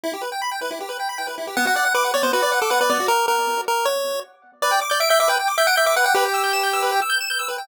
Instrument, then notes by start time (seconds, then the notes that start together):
lead 1 (square)
0.04 E4
0.13 G4
0.21 B4
0.32 G5
0.42 B5
0.52 G5
0.61 B4
0.71 E4
0.80 G4
0.89 B4
1.00 G5
1.09 B5
1.18 G5
1.27 B4
1.38 E4
1.47 G4
1.57 B3 F#5
1.66 F#4 F#5
1.76 D5 F#5
1.85 F#5
1.95 B4 D6
2.04 F#5
2.14 C#5 D5
2.23 B3 C5
2.33 F#4 B4
2.42 D5
2.52 F#5
2.62 A4 D6
2.70 B4 F#5
2.81 B4 D5
2.89 B3 D5
3.00 F#4
3.08 A#4
3.28 A#4
3.68 A#4
3.85 C#5
4.62 B4 D5
4.71 G5
4.81 D6
4.90 D5 G6
5.00 E5 D7
5.09 E5 G6
5.20 E5 D6
5.28 B4 G5
5.39 G5
5.48 D6
5.58 E5 G6
5.67 F#5 D7
5.76 E5 G6
5.86 E5 D6
5.96 B4 F#5
6.04 F#5 G5
6.14 G4 B4
6.25 G5
6.34 E6
6.44 G6
6.53 E7
6.63 G6
6.73 E6
6.82 B4
6.92 G5
7.02 E6
7.10 G6
7.21 E7
7.30 G6
7.39 E6
7.48 B4
7.58 G5